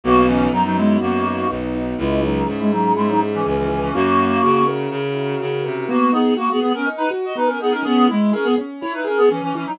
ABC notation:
X:1
M:4/4
L:1/16
Q:1/4=123
K:B
V:1 name="Clarinet"
[A,F]2 [E,C]2 [F,D] [F,D] [G,E]2 [A,F]4 z4 | [G,E]2 [F,D]2 z [G,E] [F,D]2 [G,E] [F,D] z [E,C] [E,C] [E,C] [E,C] [E,C] | [A,F]6 z10 | [A,F]2 [B,G]2 [A,F] [B,G] [B,G] [CA] z [DB] z [Fd] [DB] [CA] [B,G] [CA] |
[B,G]2 [G,E]2 [CA] [B,G] z2 [Ec] [DB] [CA] [B,G] [E,C] [E,C] [E,C] [F,D] |]
V:2 name="Acoustic Grand Piano"
B,2 D2 F2 B,2 D2 F2 B,2 D2 | C2 E2 G2 C2 E2 G2 C2 E2 | C2 E2 F2 A2 C2 E2 F2 A2 | B,2 D2 F2 B,2 D2 F2 B,2 D2 |
C2 E2 G2 C2 E2 G2 C2 E2 |]
V:3 name="Violin" clef=bass
B,,,4 F,,4 F,,4 B,,,4 | C,,4 G,,4 G,,4 C,,4 | F,,4 C,4 C,4 C,2 =C,2 | z16 |
z16 |]